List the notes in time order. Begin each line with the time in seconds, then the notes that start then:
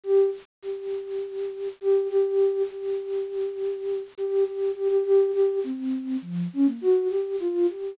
0.04 G4
0.62 G4
1.81 G4
2.09 G4
2.71 G4
4.18 G4
4.45 G4
4.75 G4
4.90 G4
5.05 G4
5.33 G4
5.64 C4
6.22 F3
6.53 C#4
6.66 A#3
6.81 F#4
7.09 G4
7.40 F4
7.70 G4